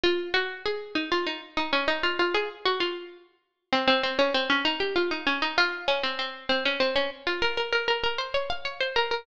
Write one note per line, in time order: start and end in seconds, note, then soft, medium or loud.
0.03 0.30 F4 medium
0.34 0.63 F#4 medium
0.66 0.92 G#4 medium
0.95 1.10 D#4 medium
1.12 1.26 F4 medium
1.27 1.41 D#4 medium
1.57 1.72 D#4 medium
1.73 1.87 C#4 medium
1.88 2.02 D#4 medium
2.03 2.18 F4 medium
2.19 2.34 F4 medium
2.34 2.49 G#4 medium
2.65 2.80 F#4 medium
2.80 3.32 F4 medium
3.73 3.87 C4 medium
3.88 4.02 C4 loud
4.03 4.18 C4 medium
4.19 4.33 C#4 medium
4.34 4.49 C4 medium
4.50 4.64 C#4 medium
4.65 4.79 D#4 medium
4.80 4.95 G4 medium
4.96 5.10 F4 medium
5.11 5.26 D#4 medium
5.27 5.41 C#4 medium
5.42 5.57 D#4 medium
5.58 5.84 F4 loud
5.88 6.02 C#4 medium
6.03 6.18 C4 medium
6.19 6.46 C4 medium
6.49 6.64 C4 medium
6.65 6.80 C#4 medium
6.80 6.95 C4 medium
6.96 7.10 C#4 medium
7.27 7.41 F4 medium
7.42 7.57 A#4 medium
7.57 7.72 A#4 medium
7.72 7.87 A#4 medium
7.88 8.03 A#4 medium
8.03 8.18 A#4 medium
8.18 8.33 C5 medium
8.34 8.49 C#5 medium
8.50 8.64 F5 medium
8.65 8.80 C#5 medium
8.80 8.95 C5 medium
8.96 9.11 A#4 medium
9.11 9.26 A#4 medium